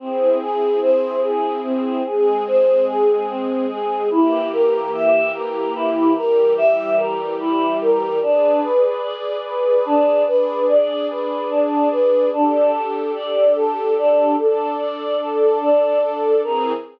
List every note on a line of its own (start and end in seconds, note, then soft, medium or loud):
0.00 0.38 C4 medium
0.00 2.03 C4 medium
0.00 2.03 E4 medium
0.00 2.03 G#4 medium
0.42 0.80 G#4 medium
0.82 1.20 C5 medium
1.23 1.61 G#4 medium
1.64 2.02 C4 medium
2.06 4.09 G#3 medium
2.06 4.09 C4 medium
2.06 4.09 G#4 medium
2.06 2.44 G#4 medium
2.47 2.85 C5 medium
2.88 3.26 G#4 medium
3.28 3.66 C4 medium
3.70 4.08 G#4 medium
4.10 6.14 E3 medium
4.10 6.14 A#3 medium
4.10 4.48 E4 medium
4.10 6.14 G4 medium
4.53 4.90 A#4 medium
4.94 5.32 E5 medium
5.34 5.72 A#4 medium
5.76 6.13 E4 medium
6.16 8.20 E3 medium
6.16 8.20 G3 medium
6.16 8.20 G4 medium
6.16 6.54 A#4 medium
6.58 6.95 E5 medium
6.97 7.35 A#4 medium
7.40 7.78 E4 medium
7.81 8.19 A#4 medium
8.22 8.60 D4 medium
8.22 10.26 G#4 medium
8.22 10.26 B4 medium
8.22 10.26 D5 medium
8.64 9.01 B4 medium
9.03 9.41 D5 medium
9.46 9.84 B4 medium
9.85 10.23 D4 medium
10.27 12.31 D4 medium
10.27 12.31 G#4 medium
10.27 10.65 B4 medium
10.27 12.31 D5 medium
10.69 11.07 D5 medium
11.10 11.48 B4 medium
11.51 11.88 D4 medium
11.91 12.29 B4 medium
12.33 14.36 D4 medium
12.33 12.71 D4 medium
12.33 14.36 G4 medium
12.33 14.36 A4 medium
12.73 13.11 A4 medium
13.15 13.53 D5 medium
13.56 13.94 A4 medium
13.98 14.36 D4 medium
14.39 16.42 D4 medium
14.39 14.76 A4 medium
14.39 16.42 A4 medium
14.39 16.42 D5 medium
14.80 15.18 D5 medium
15.21 15.58 A4 medium
15.61 15.99 D4 medium
16.03 16.40 A4 medium
16.43 16.72 E3 medium
16.43 16.72 C4 medium
16.43 16.72 G#4 loud
16.43 16.72 A#4 loud